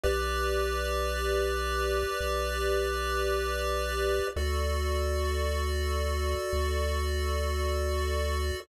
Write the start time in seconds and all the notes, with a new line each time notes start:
0.03 B1 G4 B4 D5
2.20 B1
4.36 D2 F#4 A4 D5
6.53 D2